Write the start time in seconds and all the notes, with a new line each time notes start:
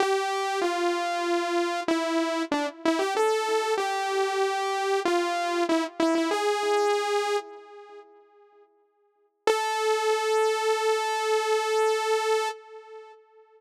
0.00 G4
0.61 F4
1.88 E4
2.52 D4
2.85 E4
2.99 G4
3.16 A4
3.78 G4
5.05 F4
5.69 E4
6.00 E4
6.15 E4
6.31 G#4
9.47 A4